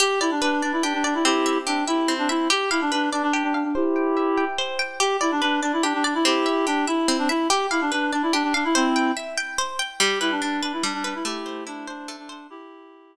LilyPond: <<
  \new Staff \with { instrumentName = "Clarinet" } { \time 6/8 \key g \major \tempo 4. = 96 g'8 e'16 d'16 d'8 d'16 e'16 d'16 d'16 d'16 e'16 | <e' g'>4 d'8 e'8. d'16 e'8 | g'8 e'16 d'16 d'8 d'16 d'16 d'16 d'16 d'16 d'16 | <e' g'>2 r4 |
g'8 e'16 d'16 d'8 d'16 e'16 d'16 d'16 d'16 e'16 | <e' g'>4 d'8 e'8. d'16 e'8 | g'8 e'16 d'16 d'8 d'16 e'16 d'16 d'16 d'16 e'16 | <c' e'>4 r2 |
g'8 e'16 d'16 d'8 d'16 e'16 d'16 d'16 d'16 e'16 | <e' g'>4 d'8 d'8. d'16 d'8 | <e' g'>2 r4 | }
  \new Staff \with { instrumentName = "Acoustic Guitar (steel)" } { \time 6/8 \key g \major g'8 d''8 b'8 d''8 g'8 d''8 | c'8 e''8 g'8 e''8 c'8 e''8 | g'8 f''8 b'8 d''8 g'8 f''8 | c''8 g''8 e''8 g''8 c''8 g''8 |
g'8 d''8 b'8 d''8 g'8 d''8 | c'8 e''8 g'8 e''8 c'8 e''8 | g'8 f''8 b'8 d''8 g'8 f''8 | c''8 g''8 e''8 g''8 c''8 g''8 |
g8 b'8 d'8 b'8 g8 b'8 | a8 c''8 e'8 c''8 a8 c''8 | r2. | }
>>